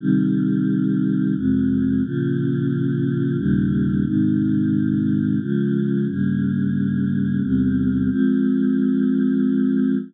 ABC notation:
X:1
M:3/4
L:1/8
Q:1/4=89
K:Fm
V:1 name="Choir Aahs"
[C,E,G,]4 [F,,C,A,]2 | [B,,D,F,]4 [E,,B,,D,G,]2 | [A,,C,E,]4 [D,F,A,]2 | [G,,D,B,]4 [=E,,C,G,]2 |
[F,A,C]6 |]